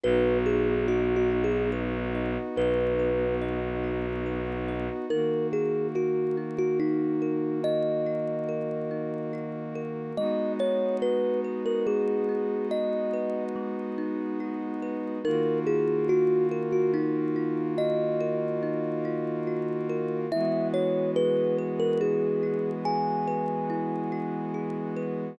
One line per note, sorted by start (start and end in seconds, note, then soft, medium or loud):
0.04 2.37 B1 loud
0.04 5.05 B3 medium
0.04 5.05 D#4 medium
0.04 1.30 F#4 loud
0.04 5.05 F#4 medium
0.04 0.38 B4 loud
0.46 0.86 G#4 medium
0.46 1.72 B4 medium
0.88 1.15 F#4 loud
0.88 2.14 D#5 medium
1.16 1.43 F#4 medium
1.30 2.57 F#4 medium
1.44 1.71 G#4 medium
1.73 2.99 B4 medium
2.15 3.41 D#5 medium
2.56 4.89 B1 medium
2.56 3.83 F#4 medium
2.56 3.35 B4 medium
2.99 4.26 B4 medium
3.42 4.68 D#5 medium
3.84 5.04 F#4 medium
4.26 5.06 B4 medium
4.68 5.08 D#5 medium
5.10 10.12 D#3 medium
5.10 10.12 A#3 medium
5.10 6.37 D#4 loud
5.10 10.12 F#4 medium
5.10 5.47 A#4 loud
5.53 6.79 F#4 medium
5.53 5.87 G#4 medium
5.95 6.36 F#4 medium
5.95 7.21 A#4 medium
6.37 7.64 D#4 medium
6.58 6.79 F#4 loud
6.80 7.60 D#4 medium
6.80 8.06 F#4 medium
7.22 8.48 A#4 medium
7.64 8.90 D#4 medium
7.64 9.81 D#5 loud
8.06 9.33 F#4 medium
8.49 9.75 A#4 medium
8.91 10.11 D#4 medium
9.33 10.13 F#4 medium
9.75 10.15 A#4 medium
10.16 15.18 G#3 medium
10.16 11.86 G#3 loud
10.16 15.18 B3 medium
10.16 15.18 D#4 medium
10.16 15.18 F#4 medium
10.16 10.53 D#5 loud
10.60 12.28 D#4 medium
10.60 10.97 C#5 loud
11.02 12.71 F#4 medium
11.02 11.40 B4 medium
11.44 13.13 B4 medium
11.66 11.86 A#4 medium
11.87 13.55 G#3 medium
11.87 12.67 G#4 medium
12.29 13.97 D#4 medium
12.71 14.40 F#4 medium
12.71 13.44 D#5 medium
13.13 14.82 B4 medium
13.56 15.16 G#3 loud
13.98 15.18 D#4 medium
14.40 15.20 F#4 medium
14.82 15.23 B4 medium
15.24 20.26 D#3 medium
15.24 20.26 A#3 medium
15.24 16.93 D#4 loud
15.24 20.26 F4 medium
15.24 20.26 F#4 medium
15.24 15.59 A#4 medium
15.67 17.35 F4 medium
15.67 16.07 G#4 medium
16.09 16.46 F#4 medium
16.09 17.78 F#4 medium
16.51 18.20 A#4 loud
16.72 16.92 F#4 medium
16.94 17.75 D#4 medium
16.94 18.62 D#4 medium
17.36 19.04 F4 loud
17.78 19.47 F#4 loud
17.78 20.18 D#5 loud
18.20 19.89 A#4 loud
18.63 20.23 D#4 loud
19.05 20.25 F4 loud
19.47 20.27 F#4 medium
19.89 20.30 A#4 loud
20.32 25.33 E3 medium
20.32 25.33 G#3 medium
20.32 25.33 B3 medium
20.32 22.00 E4 loud
20.32 25.33 F#4 medium
20.32 20.68 E5 loud
20.74 22.42 F#4 medium
20.74 21.11 C#5 medium
21.16 22.85 G#4 medium
21.16 21.57 B4 loud
21.58 23.27 B4 medium
21.80 22.00 A#4 loud
22.01 23.69 E4 medium
22.01 22.70 G#4 medium
22.43 24.11 F#4 medium
22.85 24.54 G#4 loud
22.85 24.94 G#5 loud
23.27 24.96 B4 loud
23.70 25.30 E4 loud
24.12 25.32 F#4 loud
24.54 25.35 G#4 medium
24.96 25.37 B4 medium